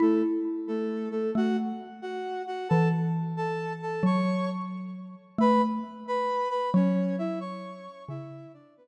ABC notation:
X:1
M:6/8
L:1/8
Q:3/8=89
K:A
V:1 name="Flute"
[A,A] z2 [A,A]2 [A,A] | [Ff] z2 [Ff]2 [Ff] | [Aa] z2 [Aa]2 [Aa] | [cc']2 z4 |
[Bb] z2 [Bb]2 [Bb] | [Cc]2 [Ee] [cc']3 | [Ee]2 [Dd] [B,B] z2 |]
V:2 name="Xylophone"
E6 | A,2 z4 | E,6 | F,6 |
A,2 z4 | F,6 | C,2 z4 |]